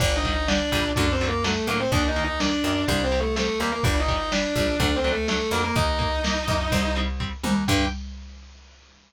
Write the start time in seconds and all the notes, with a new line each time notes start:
0.00 G1 D3 G3 D4 D5, kick, crash
0.16 D#4 D#5
0.24 D3 G3, kick, closed hi-hat
0.32 D#4 D#5
0.48 D3 G3 D4 D5, snare
0.72 A#1 D3 G3, kick, closed hi-hat
0.96 F#2 D3 F#3 A3 D4 D5, kick, closed hi-hat
1.12 C4 C5
1.20 D3 F#3 A3, closed hi-hat
1.28 A#3 A#4
1.44 D3 F#3 A3 A4, snare
1.67 A2 D3 F#3 A3 A#3 A#4, closed hi-hat
1.80 C4 C5
1.92 D#2 D#3 A#3 D4 D5, kick, closed hi-hat
2.08 D#4 D#5
2.16 D#3 A#3, closed hi-hat
2.24 D#4 D#5
2.40 D#3 A#3 D4 D5, snare
2.64 F#2 D#3 A#3, closed hi-hat
2.88 C2 G3 C4 D4 D5, kick, closed hi-hat
3.04 C4 C5
3.12 G3 C4, closed hi-hat
3.20 A3 A4
3.36 G3 A3 C4 A4, snare
3.59 D#2 G3 A#3 C4 A#4, closed hi-hat
3.72 A#3 A#4
3.83 G1 G3 D4 D5, kick, closed hi-hat
4.00 D#4 D#5
4.08 G3 D4, kick, closed hi-hat
4.16 D#4 D#5
4.32 G3 D4 D5, snare
4.55 A#1 G3 D4, kick, closed hi-hat
4.80 D2 F#3 A3 D4 D5, kick, closed hi-hat
4.96 C4 C5
5.04 F#3 A3 D4, closed hi-hat
5.12 A3 A4
5.28 F#3 A3 D4 A4, snare
5.51 F2 F#3 A3 A#3 D4 A#4, closed hi-hat
5.64 A#3 A#4
5.75 D#2 A#3 D#4 D#5, kick, closed hi-hat
5.99 A#3 D#4, kick, closed hi-hat
6.24 A#3 D#4, snare
6.48 F#2 A#3 D#4, kick, closed hi-hat
6.72 C2 G3 C4, kick, closed hi-hat
6.96 G3 C4, closed hi-hat
7.20 G3 C4, kick
7.43 D#2 G3 C4, high tom
7.68 G2 D3 G3 G5, kick, crash